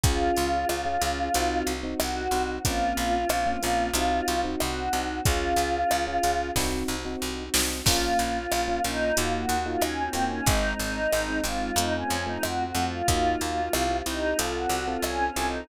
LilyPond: <<
  \new Staff \with { instrumentName = "Choir Aahs" } { \time 4/4 \key bes \minor \tempo 4 = 92 f'2. ges'4 | f'2. ges'4 | f'2 r2 | f'8 f'4 ees'8 f'16 ges'8 f'16 \tuplet 3/2 { des'8 c'8 des'8 } |
ees'8 ees'4 f'8 ees'16 des'8 ees'16 \tuplet 3/2 { ges'8 ges'8 f'8 } | f'8 f'4 ees'8 f'16 ges'8 f'16 \tuplet 3/2 { des'8 des'8 ees'8 } | }
  \new Staff \with { instrumentName = "Electric Piano 1" } { \time 4/4 \key bes \minor <des' f' aes'>4~ <des' f' aes'>16 <des' f' aes'>16 <des' f' aes'>8 <c' ees' ges'>8. <c' ees' ges'>8. <c' ees' ges'>8 | <bes c' des' f'>4~ <bes c' des' f'>16 <bes c' des' f'>16 <bes c' des' f'>8 <c' ees' ges'>8. <c' ees' ges'>8. <c' ees' ges'>8 | <des' f' aes'>4~ <des' f' aes'>16 <des' f' aes'>16 <des' f' aes'>8 <c' ees' ges'>8. <c' ees' ges'>8. <c' ees' ges'>8 | <bes des' f'>4~ <bes des' f'>16 <bes des' f'>16 <bes des' f'>8 <bes ees' f' ges'>8. <bes ees' f' ges'>8. <bes ees' f' ges'>8 |
<aes c' ees'>4~ <aes c' ees'>16 <aes c' ees'>16 <aes c' ees'>8 <a c' f'>8. <a c' f'>8. <a c' f'>8 | <bes ees' f' ges'>4 <c' e' g'>16 <c' e' g'>16 <c' e' g'>8 <c' f' a'>8. <c' f' a'>8. <c' f' a'>8 | }
  \new Staff \with { instrumentName = "Electric Bass (finger)" } { \clef bass \time 4/4 \key bes \minor des,8 des,8 des,8 des,8 c,8 c,8 c,8 c,8 | bes,,8 bes,,8 bes,,8 bes,,8 c,8 c,8 c,8 c,8 | des,8 des,8 des,8 des,8 c,8 c,8 c,8 c,8 | bes,,8 bes,,8 bes,,8 bes,,8 ees,8 ees,8 ees,8 ees,8 |
aes,,8 aes,,8 aes,,8 aes,,8 f,8 f,8 f,8 f,8 | ees,8 ees,8 c,8 c,8 c,8 c,8 c,8 c,8 | }
  \new Staff \with { instrumentName = "String Ensemble 1" } { \time 4/4 \key bes \minor <des' f' aes'>2 <c' ees' ges'>2 | <bes c' des' f'>2 <c' ees' ges'>2 | <des' f' aes'>2 <c' ees' ges'>2 | <bes des' f'>2 <bes ees' f' ges'>2 |
<aes c' ees'>2 <a c' f'>2 | <bes ees' f' ges'>4 <c' e' g'>4 <c' f' a'>2 | }
  \new DrumStaff \with { instrumentName = "Drums" } \drummode { \time 4/4 <hh bd>8 hh8 ss8 hh8 hh8 hh8 ss8 hh8 | <hh bd>8 hh8 ss8 hh8 hh8 hh8 ss8 hh8 | <hh bd>8 hh8 ss8 hh8 <bd sn>4 r8 sn8 | <cymc bd>8 hh8 ss8 hh8 hh8 hh8 ss8 hh8 |
<hh bd>8 hh8 ss8 hh8 hh8 hh8 ss8 hh8 | <hh bd>8 hh8 ss8 hh8 hh8 hh8 ss8 hh8 | }
>>